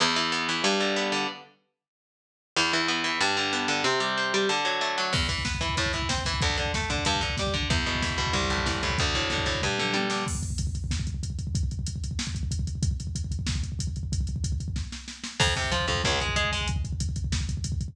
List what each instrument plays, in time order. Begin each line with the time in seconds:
0.00 overdriven guitar E2
0.16 overdriven guitar E3
0.32 overdriven guitar B3
0.49 overdriven guitar E3
0.64 overdriven guitar G2
0.80 overdriven guitar D3
0.96 overdriven guitar B3
1.12 overdriven guitar D3
2.56 overdriven guitar E2
2.73 overdriven guitar E3
2.88 overdriven guitar B3
3.04 overdriven guitar E3
3.21 overdriven guitar G2
3.37 overdriven guitar D3
3.53 overdriven guitar B3
3.68 overdriven guitar D3
3.84 overdriven guitar C3
4.00 overdriven guitar G3
4.17 overdriven guitar C4
4.34 overdriven guitar G3
4.49 overdriven guitar D3
4.65 overdriven guitar F#3
4.81 overdriven guitar A3
4.98 overdriven guitar F#3
5.13 overdriven guitar E2, kick, crash
5.22 kick
5.29 overdriven guitar E3, kick, closed hi-hat
5.38 kick
5.45 overdriven guitar B3, kick, snare
5.55 kick
5.61 overdriven guitar E3, kick, closed hi-hat
5.69 kick
5.77 overdriven guitar A2, kick, closed hi-hat
5.86 kick
5.93 overdriven guitar E3, kick, closed hi-hat
6.02 kick
6.09 overdriven guitar C4, kick, snare
6.18 kick
6.25 overdriven guitar E3, kick, open hi-hat
6.34 kick
6.41 overdriven guitar D2, kick, closed hi-hat
6.50 kick
6.57 overdriven guitar D3, kick, closed hi-hat
6.66 kick
6.74 overdriven guitar A3, kick, snare
6.82 kick
6.90 overdriven guitar D3, kick, closed hi-hat
6.98 kick
7.05 overdriven guitar G2, kick, closed hi-hat
7.15 kick
7.21 overdriven guitar D3, kick, closed hi-hat
7.30 kick
7.37 overdriven guitar G3, kick, snare
7.47 kick
7.54 overdriven guitar D3, kick, closed hi-hat
7.63 kick
7.70 overdriven guitar E2, kick, closed hi-hat
7.78 kick
7.86 overdriven guitar B2, kick, closed hi-hat
7.95 kick
8.02 overdriven guitar E3, kick, snare
8.10 kick
8.18 overdriven guitar B2, kick, closed hi-hat
8.27 kick
8.33 overdriven guitar C2, kick, closed hi-hat
8.42 kick
8.50 overdriven guitar A2, kick, closed hi-hat
8.58 kick
8.66 overdriven guitar E3, kick, snare
8.74 kick
8.83 overdriven guitar A2, kick, closed hi-hat
8.90 kick
8.98 overdriven guitar D2, kick, closed hi-hat
9.07 kick
9.14 overdriven guitar A2, kick, closed hi-hat
9.22 kick
9.30 overdriven guitar D3, kick, snare
9.38 kick
9.46 overdriven guitar A2, kick, closed hi-hat
9.55 kick
9.62 overdriven guitar G2, kick, floor tom
9.78 overdriven guitar D3, mid tom
9.94 overdriven guitar G3, high tom
10.10 overdriven guitar D3, snare
10.27 kick, crash
10.35 kick
10.43 kick, closed hi-hat
10.50 kick
10.58 kick, closed hi-hat
10.67 kick
10.75 kick, closed hi-hat
10.84 kick
10.91 kick, snare
11.00 kick
11.07 kick, closed hi-hat
11.14 kick
11.23 kick, closed hi-hat
11.30 kick
11.39 kick, closed hi-hat
11.47 kick
11.55 kick, closed hi-hat
11.63 kick
11.71 kick, closed hi-hat
11.79 kick
11.86 kick, closed hi-hat
11.96 kick
12.04 kick, closed hi-hat
12.11 kick
12.19 snare
12.27 kick
12.35 kick, closed hi-hat
12.43 kick
12.51 kick, closed hi-hat
12.59 kick
12.67 kick, closed hi-hat
12.75 kick
12.83 kick, closed hi-hat
12.91 kick
13.00 kick, closed hi-hat
13.07 kick
13.15 kick, closed hi-hat
13.24 kick
13.31 kick, closed hi-hat
13.39 kick
13.47 kick, snare
13.55 kick
13.63 kick, closed hi-hat
13.72 kick
13.79 kick, closed hi-hat
13.87 kick
13.96 kick, closed hi-hat
14.03 kick
14.12 kick, closed hi-hat
14.21 kick
14.27 kick, closed hi-hat
14.36 kick
14.44 kick, closed hi-hat
14.52 kick
14.60 kick, closed hi-hat
14.68 kick
14.76 kick, snare
14.92 snare
15.08 snare
15.24 snare
15.40 overdriven guitar F2, kick, crash
15.47 kick
15.56 overdriven guitar C3, kick, closed hi-hat
15.64 kick
15.72 overdriven guitar F3, kick, closed hi-hat
15.80 kick
15.88 overdriven guitar F2, kick, closed hi-hat
15.95 kick
16.04 overdriven guitar C#2, kick, snare
16.12 kick
16.20 overdriven guitar G#3, kick, closed hi-hat
16.29 kick
16.36 overdriven guitar G#3, kick, closed hi-hat
16.44 kick
16.52 overdriven guitar G#3, kick, open hi-hat
16.61 kick
16.68 kick, closed hi-hat
16.76 kick
16.84 kick, closed hi-hat
16.93 kick
17.00 kick, closed hi-hat
17.09 kick
17.16 kick, closed hi-hat
17.24 kick
17.32 kick, snare
17.41 kick
17.49 kick, closed hi-hat
17.57 kick
17.64 kick, closed hi-hat
17.72 kick
17.81 kick, closed hi-hat
17.88 kick